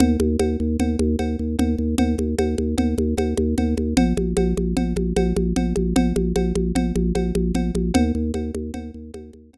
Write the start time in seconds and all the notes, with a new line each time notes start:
0.00 D#2, cowbell, low conga
0.20 D#2, high conga
0.39 D#2, cowbell, high conga
0.60 D#2
0.79 D#2, cowbell, low conga
0.99 D#2, high conga
1.19 D#2, cowbell, high conga
1.39 D#2
1.59 D#2, cowbell, low conga
1.78 D#2
1.98 D#2, cowbell, low conga
2.18 D#2, high conga
2.38 D#2, cowbell, high conga
2.58 D#2, high conga
2.78 D#2, cowbell, low conga
2.98 D#2, high conga
3.17 D#2, cowbell, high conga
3.37 D#2, high conga
3.58 D#2, cowbell, low conga
3.77 D#2, high conga
3.97 A#1, cowbell, low conga
4.17 A#1, high conga
4.37 A#1, cowbell, high conga
4.57 A#1, high conga
4.77 A#1, cowbell, low conga
4.96 A#1, high conga
5.16 A#1, cowbell, high conga
5.36 A#1, high conga
5.56 A#1, cowbell, low conga
5.76 A#1, high conga
5.96 A#1, cowbell, low conga
6.16 A#1, high conga
6.36 A#1, cowbell, high conga
6.55 A#1, high conga
6.75 A#1, cowbell, low conga
6.96 A#1, high conga
7.15 A#1, cowbell, high conga
7.35 A#1, high conga
7.54 A#1, cowbell, low conga
7.75 A#1, high conga
7.94 D#2, cowbell, low conga
8.15 D#2
8.34 D#2, cowbell, high conga
8.54 D#2, high conga
8.74 D#2, cowbell, low conga
8.94 D#2
9.14 D#2, cowbell, high conga
9.33 D#2, high conga
9.53 D#2, cowbell, low conga